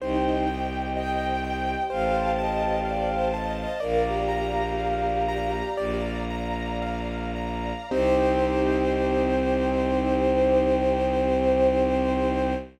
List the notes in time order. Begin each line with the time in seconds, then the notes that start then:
0.00 C2 D#4 G4 C5 D#5 G5
0.45 G4 G5
0.94 D#5 G5
1.44 G5
1.89 A1 C5 F5 A5
2.38 D#5 A5
2.85 D5 F5
3.11 C5
3.34 D#5 A5
3.57 D#5
3.80 A#1 A#3 A#4 D5 F5 A#5
4.05 G4
4.29 A#5
4.78 F5
5.28 A#5
5.77 A#1 D5 F5 A#5
6.30 A#5
6.82 F5
7.36 A#5
7.89 C2 C4 D#4 G4 C5